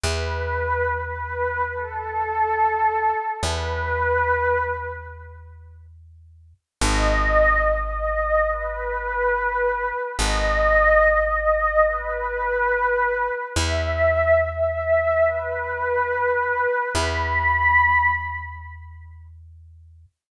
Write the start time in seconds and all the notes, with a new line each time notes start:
0.04 E2 B4
0.89 B4
1.74 A4
3.42 E2 B4
6.81 G#1 D#5
7.66 D#5
8.49 B4
10.19 G#1 D#5
11.02 D#5
11.86 B4
13.56 E2 E5
14.41 E5
15.25 B4
16.95 E2 B5